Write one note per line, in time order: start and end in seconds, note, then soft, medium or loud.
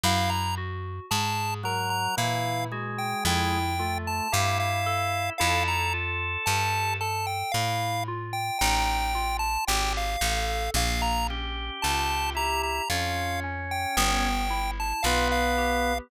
0.03 1.00 F#2 medium
0.03 0.52 E4 loud
0.03 0.30 F5 medium
0.29 0.55 A#5 medium
0.57 1.06 F#4 medium
1.11 2.08 G#2 medium
1.11 1.59 G#4 medium
1.11 1.54 A5 medium
1.63 2.15 F#3 medium
1.63 2.13 A#4 medium
1.63 1.90 A#5 medium
1.90 2.15 A#5 medium
2.17 3.14 A#2 medium
2.17 2.66 E3 medium
2.17 2.67 E4 loud
2.17 2.65 F5 medium
2.71 3.59 G#3 medium
2.71 3.20 F#4 medium
2.98 3.24 G5 medium
3.25 4.21 F2 medium
3.25 3.73 E4 loud
3.25 3.98 G5 medium
3.79 4.27 A3 medium
3.79 4.27 F4 medium
4.07 4.33 A5 medium
4.32 5.30 G2 medium
4.32 5.33 E4 medium
4.32 4.81 G4 medium
4.32 4.58 F5 medium
4.60 5.30 F5 medium
4.86 5.34 A4 medium
5.38 6.37 F2 medium
5.38 5.88 E4 loud
5.38 6.96 A4 medium
5.38 5.63 F5 medium
5.68 5.93 A#5 medium
5.94 6.42 F4 medium
6.46 7.43 G2 medium
6.46 6.96 G4 medium
6.46 6.94 A5 medium
7.01 7.49 A4 medium
7.01 7.26 A5 medium
7.27 7.52 G5 medium
7.52 8.50 A2 medium
7.52 8.02 E4 medium
7.52 8.04 F5 medium
8.08 8.56 F4 medium
8.33 8.58 G5 medium
8.59 9.58 A1 medium
8.59 9.09 D#4 loud
8.59 9.37 G5 medium
9.15 9.63 F4 medium
9.39 9.65 A5 medium
9.67 10.17 G#1 medium
9.67 10.16 G4 medium
9.67 9.93 G5 medium
9.97 10.71 F5 medium
10.21 10.69 A1 medium
10.21 10.70 A4 medium
10.74 11.71 A#1 medium
10.74 11.24 A#3 loud
10.74 11.02 F5 medium
11.02 11.27 A#5 medium
11.29 11.77 C#4 medium
11.29 12.32 G4 medium
11.82 12.80 C#2 medium
11.82 12.31 F4 medium
11.82 12.30 A5 medium
12.35 12.82 E4 medium
12.35 12.84 G4 medium
12.35 12.62 A#5 medium
12.63 12.89 A#5 medium
12.90 13.86 F2 medium
12.90 14.28 C#4 medium
12.90 13.38 F4 medium
12.90 13.40 F5 medium
13.44 13.92 C#4 medium
13.71 13.96 G5 medium
13.97 14.93 G1 medium
13.97 14.46 B3 loud
13.97 14.71 G5 medium
14.50 14.98 E4 medium
14.80 15.05 A5 medium
15.03 16.00 B1 medium
15.03 15.93 B3 medium
15.03 15.52 F4 medium
15.03 15.28 F5 medium
15.31 15.98 F5 medium
15.58 16.06 G4 medium